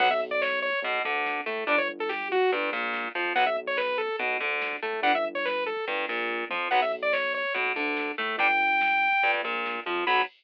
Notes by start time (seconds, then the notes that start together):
0.00 B1 F#3 B3 F#5, kick, crash
0.11 E5, kick
0.20 kick, closed hi-hat
0.31 D5, kick
0.42 C#5, kick, snare
0.52 kick
0.62 C#5, kick, closed hi-hat
0.73 kick
0.82 B1 B2, kick, closed hi-hat
0.94 kick
1.05 D2 D3, kick, closed hi-hat
1.15 kick
1.26 kick, snare
1.36 kick
1.46 A2 A3, kick, closed hi-hat
1.57 kick
1.67 G1 G3 D4 D5, kick, closed hi-hat
1.78 C#5, kick
1.89 kick, closed hi-hat
1.99 A4, kick
2.09 G4, kick, snare
2.21 kick
2.31 F#4, kick, closed hi-hat
2.42 kick
2.52 G1 G2, kick, closed hi-hat
2.63 kick
2.72 A#1 A#2, kick, closed hi-hat
2.83 kick
2.93 kick, snare
3.04 kick
3.14 F2 F3, kick, closed hi-hat
3.25 kick
3.35 B1 F#3 B3 F#5, kick, closed hi-hat
3.46 E5, kick
3.56 kick, closed hi-hat
3.66 C#5, kick
3.77 B4, kick, snare
3.89 kick
3.98 A4, kick, closed hi-hat
4.08 kick
4.19 B1 B2, kick, closed hi-hat
4.30 kick
4.40 D2 D3, kick, closed hi-hat
4.52 kick
4.62 kick, snare
4.72 kick
4.82 A2 A3, kick, closed hi-hat
4.93 kick
5.02 G1 G3 D4 F#5, kick, closed hi-hat
5.15 E5, kick
5.25 kick, closed hi-hat
5.35 C#5, kick
5.45 B4, kick, snare
5.55 kick
5.66 A4, kick, closed hi-hat
5.76 kick
5.87 G1 G2, kick, closed hi-hat
5.97 kick
6.08 A#1 A#2, kick, closed hi-hat
6.20 kick
6.29 kick, floor tom
6.50 F2 F3, high tom
6.71 B1 F#3 B3 F#5, kick, crash
6.82 E5, kick
6.92 kick, closed hi-hat
7.02 D5, kick
7.12 C#5, kick, snare
7.24 kick
7.34 C#5, kick, closed hi-hat
7.45 kick
7.54 B1 B2, kick, closed hi-hat
7.66 kick
7.76 D2 D3, kick, closed hi-hat
7.87 kick
7.97 kick, snare
8.07 kick
8.18 A2 A3, kick, closed hi-hat
8.29 kick
8.38 G1 G3 D4 G5, kick, closed hi-hat
8.50 kick
8.60 kick, closed hi-hat
8.71 kick
8.80 kick, snare
8.92 kick
9.02 kick, closed hi-hat
9.12 kick
9.23 G1 G2, kick, closed hi-hat
9.34 kick
9.43 A#1 A#2, kick, closed hi-hat
9.54 kick
9.65 kick, snare
9.75 kick
9.85 F2 F3, kick, closed hi-hat
9.96 kick
10.07 B1 F#3 B3 B5, kick, crash